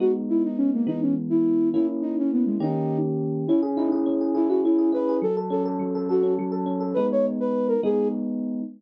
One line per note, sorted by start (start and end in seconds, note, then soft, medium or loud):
0.00 0.85 G#3 medium
0.00 0.85 B3 medium
0.00 0.85 D#4 medium
0.00 0.12 F#4 medium
0.29 0.43 E4 medium
0.44 0.58 D#4 medium
0.57 0.71 C#4 medium
0.73 0.87 A#3 medium
0.87 1.72 E3 medium
0.87 1.72 G#3 medium
0.87 1.72 B3 medium
0.87 1.00 D#4 medium
1.02 1.15 C#4 medium
1.30 1.69 E4 medium
1.73 2.59 A#3 medium
1.73 2.59 C#4 medium
1.73 1.87 E4 medium
1.73 2.59 E4 medium
2.02 2.16 D#4 medium
2.18 2.31 C#4 medium
2.33 2.45 B3 medium
2.46 2.57 G#3 medium
2.60 3.45 D#3 medium
2.60 3.45 A#3 medium
2.60 3.45 C#4 medium
2.60 2.98 D#4 medium
2.60 3.45 G4 medium
3.47 4.06 C#4 loud
3.47 3.61 E4 medium
3.62 3.91 G#4 medium
3.76 3.88 D#4 medium
3.76 4.49 E4 medium
3.92 4.20 G#4 medium
4.06 4.64 C#4 medium
4.21 4.34 G#4 medium
4.34 4.48 E4 medium
4.34 4.78 G#4 medium
4.49 4.92 E4 medium
4.49 4.61 F#4 medium
4.64 5.20 C#4 medium
4.64 4.91 E4 medium
4.78 5.08 G#4 medium
4.92 5.20 E4 medium
4.92 5.17 B4 medium
5.09 5.22 G#4 medium
5.22 5.79 F#3 medium
5.22 5.36 A4 medium
5.37 5.65 A4 medium
5.50 6.22 C#4 medium
5.50 5.63 A4 medium
5.65 5.94 A4 medium
5.79 6.38 F#3 medium
5.95 6.08 A4 medium
6.09 6.34 F#4 medium
6.09 6.51 A4 medium
6.23 6.65 C#4 medium
6.38 6.94 F#3 medium
6.52 6.80 A4 medium
6.66 6.93 C#4 medium
6.80 6.94 A4 medium
6.94 7.75 G#3 medium
6.94 7.75 B3 medium
6.94 7.75 D#4 medium
6.94 7.07 B4 medium
7.12 7.26 C#5 medium
7.40 7.67 B4 medium
7.68 7.81 A#4 medium
7.83 8.61 G#3 medium
7.83 8.61 B3 medium
7.83 8.61 D#4 medium
7.83 8.08 G#4 medium